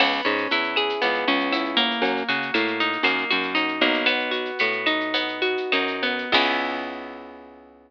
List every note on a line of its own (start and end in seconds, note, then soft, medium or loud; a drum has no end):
0.00 0.21 C#2 loud
0.00 1.01 B3 loud
0.00 crash medium
0.00 cowbell medium
0.00 claves medium
0.12 shaker medium
0.25 0.47 G#2 medium
0.25 1.27 C#4 medium
0.25 shaker medium
0.38 shaker medium
0.51 0.94 E2 medium
0.51 1.52 E4 medium
0.51 shaker medium
0.63 shaker medium
0.76 1.98 G#4 medium
0.76 claves medium
0.76 shaker medium
0.89 shaker medium
1.01 1.25 C#2 medium
1.01 1.98 B3 medium
1.01 cowbell medium
1.01 shaker medium
1.14 shaker medium
1.27 1.92 C#2 medium
1.27 2.00 C#4 medium
1.27 shaker medium
1.40 shaker medium
1.52 2.01 E4 medium
1.52 cowbell medium
1.52 claves medium
1.52 shaker loud
1.65 shaker medium
1.77 2.53 A#3 loud
1.77 cowbell medium
1.77 shaker medium
1.91 shaker medium
2.02 2.23 F#2 medium
2.02 cowbell medium
2.02 shaker medium
2.17 shaker medium
2.28 2.51 C#3 medium
2.28 3.30 F#4 medium
2.28 shaker medium
2.42 shaker medium
2.54 2.98 A2 medium
2.54 3.03 A#3 medium
2.54 claves medium
2.54 shaker medium
2.67 shaker medium
2.80 3.54 D#4 medium
2.80 shaker medium
2.92 shaker medium
3.03 3.25 F#2 medium
3.03 3.81 A#3 medium
3.03 cowbell medium
3.03 claves medium
3.03 shaker medium
3.18 shaker medium
3.31 3.80 F#2 medium
3.31 4.03 F#4 medium
3.31 shaker medium
3.43 shaker medium
3.55 4.03 D#4 medium
3.55 cowbell medium
3.55 shaker medium
3.68 shaker medium
3.81 4.51 B1 medium
3.81 4.06 A#3 medium
3.81 cowbell medium
3.81 shaker medium
3.94 shaker medium
4.06 4.59 B3 loud
4.06 cowbell medium
4.06 claves loud
4.06 shaker medium
4.19 shaker medium
4.31 5.41 F#4 medium
4.31 shaker medium
4.45 shaker medium
4.59 5.56 A2 medium
4.59 5.13 B3 medium
4.59 shaker loud
4.72 shaker medium
4.86 5.72 D#4 medium
4.86 claves medium
4.86 shaker medium
5.00 shaker medium
5.14 6.02 B3 medium
5.14 cowbell medium
5.14 shaker loud
5.28 shaker medium
5.42 6.28 F#4 medium
5.42 shaker medium
5.57 shaker medium
5.72 6.25 F#2 medium
5.72 6.31 D#4 medium
5.72 cowbell medium
5.72 claves medium
5.72 shaker medium
5.87 shaker medium
6.02 6.33 B3 medium
6.02 cowbell medium
6.02 shaker medium
6.18 shaker medium
6.32 7.91 C#2 loud
6.32 7.91 B3 loud
6.32 7.91 C#4 medium
6.32 7.91 E4 loud
6.32 7.91 G#4 loud
6.32 kick loud
6.32 crash loud